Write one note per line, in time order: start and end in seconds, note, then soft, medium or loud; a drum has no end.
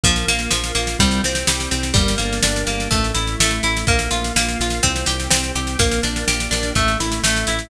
0.04 0.24 A#1 loud
0.04 0.26 F3 medium
0.04 0.51 A#3 loud
0.04 kick loud
0.04 snare medium
0.16 snare medium
0.28 0.48 A#1 medium
0.28 0.50 A#3 medium
0.28 0.75 F4 medium
0.28 snare medium
0.39 snare medium
0.51 0.72 A#1 medium
0.51 0.72 F3 medium
0.51 0.97 A#3 medium
0.51 snare loud
0.64 snare medium
0.75 0.96 A#1 medium
0.75 0.97 A#3 medium
0.75 0.98 F4 medium
0.75 snare medium
0.87 snare medium
0.99 1.20 C2 medium
0.99 1.22 G3 medium
0.99 1.47 C4 medium
0.99 kick loud
0.99 snare loud
1.11 snare medium
1.24 1.44 C2 medium
1.24 1.47 C4 medium
1.24 1.71 G4 medium
1.24 snare medium
1.35 snare medium
1.47 1.68 C2 medium
1.47 1.69 G3 medium
1.47 1.93 C4 medium
1.47 snare loud
1.60 snare medium
1.71 1.92 C2 medium
1.71 1.93 C4 medium
1.71 1.94 G4 medium
1.71 snare medium
1.83 snare medium
1.94 2.16 G1 loud
1.94 2.15 G3 medium
1.94 2.67 A#3 loud
1.94 kick loud
1.94 snare medium
2.08 snare medium
2.18 2.40 G1 medium
2.18 2.40 A#3 medium
2.18 2.88 D4 medium
2.18 snare medium
2.33 snare medium
2.43 2.64 G1 medium
2.43 2.65 D4 medium
2.43 2.89 G4 medium
2.43 snare loud
2.56 snare medium
2.67 2.88 G1 medium
2.67 2.89 A#3 medium
2.67 2.90 A#3 medium
2.67 snare medium
2.80 snare medium
2.91 3.12 A1 medium
2.91 3.12 A3 medium
2.91 3.39 A3 loud
2.91 kick loud
2.91 snare medium
3.04 snare medium
3.15 3.36 A1 medium
3.15 3.36 E4 medium
3.15 3.63 E4 medium
3.15 snare medium
3.27 snare medium
3.40 3.60 A1 medium
3.40 3.85 A3 medium
3.40 3.62 A3 medium
3.40 snare loud
3.51 snare medium
3.63 3.84 A1 medium
3.63 3.86 E4 medium
3.63 3.85 E4 medium
3.63 snare medium
3.77 snare medium
3.87 4.08 A#1 loud
3.87 4.35 A#3 medium
3.87 4.10 A#3 medium
3.87 kick loud
3.87 snare medium
3.99 snare medium
4.11 4.32 A#1 medium
4.11 4.33 F4 medium
4.11 4.59 F4 medium
4.11 snare medium
4.24 snare medium
4.36 4.56 A#1 medium
4.36 4.81 A#3 medium
4.36 4.58 A#3 medium
4.36 snare loud
4.49 snare medium
4.59 4.80 A#1 medium
4.59 4.82 F4 medium
4.59 4.83 F4 medium
4.59 snare medium
4.70 snare medium
4.83 5.04 C2 medium
4.83 5.05 C4 medium
4.83 5.31 C4 loud
4.83 kick medium
4.83 snare medium
4.96 snare medium
5.06 5.28 C2 medium
5.06 5.29 G4 medium
5.06 5.55 G4 medium
5.06 snare loud
5.20 snare medium
5.30 5.52 C2 medium
5.30 5.52 C4 medium
5.30 5.77 C4 medium
5.30 snare loud
5.44 snare medium
5.55 5.76 C2 medium
5.55 5.78 G4 medium
5.55 5.77 G4 medium
5.55 snare medium
5.67 snare medium
5.79 6.00 A#1 medium
5.79 6.01 A#3 medium
5.79 6.51 A#3 medium
5.79 kick loud
5.79 snare loud
5.91 snare medium
6.03 6.24 A#1 medium
6.03 6.25 D4 medium
6.03 6.72 D4 medium
6.03 snare medium
6.16 snare medium
6.28 6.48 A#1 medium
6.28 6.73 G4 medium
6.28 6.50 G4 medium
6.28 snare loud
6.40 snare medium
6.51 6.72 A#1 medium
6.51 6.74 A#3 medium
6.51 6.73 D4 medium
6.51 snare loud
6.63 snare medium
6.75 6.96 A1 medium
6.75 7.23 A3 medium
6.75 6.98 A3 medium
6.75 kick medium
6.75 snare medium
6.88 snare medium
7.00 7.20 A1 medium
7.00 7.47 E4 medium
7.00 7.22 E4 medium
7.00 snare medium
7.12 snare medium
7.24 7.44 A1 medium
7.24 7.69 A3 medium
7.24 7.45 A3 medium
7.24 snare loud
7.36 snare medium
7.47 7.68 A1 medium
7.47 7.69 E4 medium
7.47 snare medium
7.59 snare medium